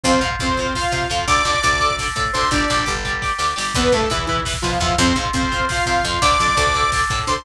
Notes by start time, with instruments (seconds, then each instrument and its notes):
0.03 electric bass (finger) F2, lead 2 (sawtooth) C4 C5, overdriven guitar F4 C5, kick, closed hi-hat
0.14 kick
0.21 electric bass (finger) G#2, overdriven guitar F4 C5, kick, closed hi-hat
0.31 kick
0.39 electric bass (finger) F2, lead 2 (sawtooth) C4 C5, overdriven guitar F4 C5, kick, closed hi-hat
0.48 kick
0.57 overdriven guitar F4 C5, kick, closed hi-hat
0.66 kick
0.75 lead 2 (sawtooth) F4 F5, overdriven guitar F4 C5, kick, snare
0.83 kick
0.92 electric bass (finger) C3, overdriven guitar F4 C5, kick, closed hi-hat
1.02 kick
1.10 electric bass (finger) F2, overdriven guitar F4 C5, kick, closed hi-hat
1.19 kick
1.27 electric bass (finger) D2, overdriven guitar A4 D5, lead 2 (sawtooth) D5 D6, kick, closed hi-hat
1.36 kick
1.45 electric bass (finger) F2, overdriven guitar A4 D5, kick, closed hi-hat
1.54 kick
1.62 electric bass (finger) D2, overdriven guitar A4 D5, kick, closed hi-hat
1.72 kick
1.80 overdriven guitar A4 D5, kick, closed hi-hat
1.91 kick
1.98 overdriven guitar A4 D5, kick, snare
2.08 kick
2.16 electric bass (finger) A2, overdriven guitar A4 D5, kick, closed hi-hat
2.25 kick
2.33 electric bass (finger) D2, overdriven guitar A4 D5, lead 2 (sawtooth) C5 C6, kick, closed hi-hat
2.42 kick
2.51 electric bass (finger) G1, lead 2 (sawtooth) D4 D5, overdriven guitar G4 D5, kick, closed hi-hat
2.60 kick
2.68 electric bass (finger) A#1, overdriven guitar G4 D5, kick, closed hi-hat
2.79 kick
2.86 electric bass (finger) G1, overdriven guitar G4 D5, kick, closed hi-hat
2.95 kick
3.05 overdriven guitar G4 D5, kick, closed hi-hat
3.13 kick
3.22 overdriven guitar G4 D5, kick, snare
3.38 electric bass (finger) D2, overdriven guitar G4 D5, snare
3.56 electric bass (finger) G1, overdriven guitar G4 D5, snare
3.74 electric bass (finger) E2, lead 2 (sawtooth) B3 B4, overdriven guitar E4 B4, kick, closed hi-hat
3.84 kick
3.92 electric bass (finger) G2, lead 2 (sawtooth) A3 A4, overdriven guitar E4 B4, kick, closed hi-hat
4.01 kick
4.10 electric bass (finger) E2, lead 2 (sawtooth) E3 E4, overdriven guitar E4 B4, kick, closed hi-hat
4.19 kick
4.26 lead 2 (sawtooth) E3 E4, overdriven guitar E4 B4, kick, closed hi-hat
4.37 kick
4.45 overdriven guitar E4 B4, kick, snare
4.54 kick
4.62 electric bass (finger) B2, lead 2 (sawtooth) F3 F4, overdriven guitar E4 B4, kick, closed hi-hat
4.72 kick
4.80 electric bass (finger) E2, lead 2 (sawtooth) F3 F4, overdriven guitar E4 B4, kick, closed hi-hat
4.89 kick
4.98 electric bass (finger) F2, lead 2 (sawtooth) C4 C5, overdriven guitar F4 C5, kick, closed hi-hat
5.07 kick
5.16 electric bass (finger) G#2, overdriven guitar F4 C5, kick, closed hi-hat
5.26 kick
5.33 electric bass (finger) F2, lead 2 (sawtooth) C4 C5, overdriven guitar F4 C5, kick, closed hi-hat
5.43 kick
5.52 overdriven guitar F4 C5, kick, closed hi-hat
5.60 kick
5.69 overdriven guitar F4 C5, lead 2 (sawtooth) F4 F5, kick, snare
5.77 kick
5.86 electric bass (finger) C3, overdriven guitar F4 C5, kick, closed hi-hat
5.95 kick
6.03 electric bass (finger) F2, overdriven guitar F4 C5, kick, closed hi-hat
6.13 kick
6.21 electric bass (finger) D2, overdriven guitar A4 D5, lead 2 (sawtooth) D5 D6, kick, closed hi-hat
6.32 kick
6.39 electric bass (finger) F2, overdriven guitar A4 D5, kick, closed hi-hat
6.48 kick
6.56 electric bass (finger) D2, overdriven guitar A4 D5, kick, closed hi-hat
6.67 kick
6.74 overdriven guitar A4 D5, kick, closed hi-hat
6.83 kick
6.92 overdriven guitar A4 D5, kick, snare
7.01 kick
7.10 electric bass (finger) A2, overdriven guitar A4 D5, kick, closed hi-hat
7.19 kick
7.27 electric bass (finger) D2, overdriven guitar A4 D5, lead 2 (sawtooth) C5 C6, kick, closed hi-hat
7.36 kick